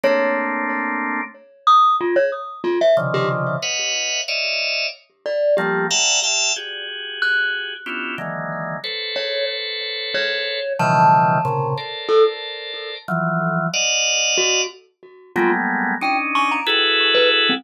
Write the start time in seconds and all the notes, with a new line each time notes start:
0.04 A3 A#3 C4 D4 C#5
1.67 D#6
2.01 F4
2.16 C#5
2.64 F4
2.81 E5
2.97 C3 C#3 D3 D#3 F3
3.14 G4
3.62 B4 C#5 D#5 F5 F#5
4.28 C#5 D5 D#5 E5 F5
5.26 D5
5.57 F3 G3 A3 A#3 G4
5.90 E5 F5 F#5 G5 A5 A#5
6.23 E5 F5 G5 A5
6.56 F#4 G4 G#4
7.22 F#6
7.86 B3 C#4 D4 E4 F4 G4
8.18 D3 D#3 E3 F#3 G#3 A#3
8.84 A4 B4 C5 C#5
9.16 C#5
10.14 C#5
10.79 B2 C#3 D#3 E3 F3 G3 A5
11.45 A#2 C3 C#3
11.77 A4 A#4 C5 D5
12.09 A4
13.08 E3 F3 F#3
13.74 D5 D#5 F5 F#5
14.38 F#4
15.36 F#3 G3 G#3 A3 A#3 B3 F4
16.01 C#4 D4 D#4 G5
16.35 C#6
16.51 A#5
16.66 E4 F#4 G#4 A4 B4
17.15 B4
17.49 C4